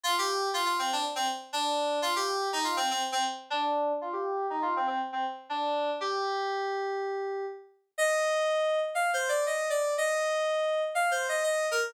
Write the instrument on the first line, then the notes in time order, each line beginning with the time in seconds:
electric piano 2
0.04 F4
0.18 G4
0.54 F4
0.65 F4
0.79 C4
0.93 D4
1.15 C4
1.53 D4
2.02 F4
2.16 G4
2.53 D#4
2.64 F4
2.77 C4
2.91 C4
3.12 C4
3.50 D4
4.01 F4
4.13 G4
4.50 D#4
4.62 F4
4.76 C4
4.87 C4
5.13 C4
5.49 D4
6.01 G4
7.98 D#5
8.95 F5
9.13 C5
9.29 D5
9.46 D#5
9.70 D5
9.98 D#5
10.95 F5
11.11 C5
11.29 D#5
11.43 D#5
11.71 A#4